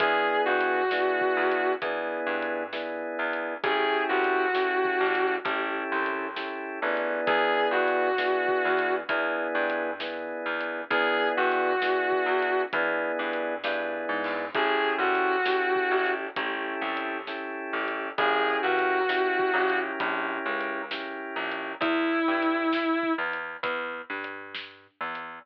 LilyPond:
<<
  \new Staff \with { instrumentName = "Distortion Guitar" } { \time 4/4 \key e \major \tempo 4 = 66 gis'8 fis'4. r2 | gis'8 fis'4. r2 | gis'8 fis'4. r2 | gis'8 fis'4. r2 |
gis'8 fis'4. r2 | gis'8 fis'4. r2 | e'4. r2 r8 | }
  \new Staff \with { instrumentName = "Drawbar Organ" } { \time 4/4 \key e \major <b d' e' gis'>4 <b d' e' gis'>4 <b d' e' gis'>4 <b d' e' gis'>4 | <cis' e' g' a'>4 <cis' e' g' a'>4 <cis' e' g' a'>4 <cis' e' g' a'>8 <b d' e' gis'>8~ | <b d' e' gis'>4 <b d' e' gis'>4 <b d' e' gis'>4 <b d' e' gis'>4 | <b d' e' gis'>4 <b d' e' gis'>4 <b d' e' gis'>4 <b d' e' gis'>4 |
<cis' e' g' a'>4 <cis' e' g' a'>4 <cis' e' g' a'>4 <cis' e' g' a'>4 | <cis' e' g' ais'>4 <cis' e' g' ais'>8 <cis' e' g' ais'>4. <cis' e' g' ais'>4 | r1 | }
  \new Staff \with { instrumentName = "Electric Bass (finger)" } { \clef bass \time 4/4 \key e \major e,8 g,4 e,8 e,8 g,4 e,8 | a,,8 c,4 a,,8 a,,8 c,4 a,,8 | e,8 g,4 e,8 e,8 g,4 e,8 | e,8 g,4 e,8 e,8 g,8 g,8 gis,8 |
a,,8 c,4 a,,8 a,,8 c,4 a,,8 | ais,,8 cis,4 ais,,8 ais,,8 cis,4 ais,,8 | e,8 g,4 e,8 e,8 g,4 e,8 | }
  \new DrumStaff \with { instrumentName = "Drums" } \drummode { \time 4/4 \tuplet 3/2 { <hh bd>8 r8 hh8 sn8 bd8 hh8 <hh bd>8 r8 hh8 sn8 r8 hh8 } | \tuplet 3/2 { <hh bd>8 r8 hh8 sn8 bd8 hh8 <hh bd>8 r8 hh8 sn8 r8 hh8 } | \tuplet 3/2 { <hh bd>8 r8 hh8 sn8 bd8 hh8 <hh bd>8 r8 hh8 sn8 r8 hh8 } | \tuplet 3/2 { <hh bd>8 r8 hh8 sn8 bd8 hh8 <hh bd>8 r8 hh8 sn8 r8 hho8 } |
\tuplet 3/2 { <hh bd>8 r8 hh8 sn8 bd8 hh8 <hh bd>8 r8 hh8 sn8 r8 hh8 } | \tuplet 3/2 { <hh bd>8 r8 hh8 sn8 bd8 hh8 <hh bd>8 r8 hh8 sn8 r8 hh8 } | \tuplet 3/2 { <hh bd>8 r8 hh8 sn8 bd8 hh8 <hh bd>8 r8 hh8 sn8 r8 hh8 } | }
>>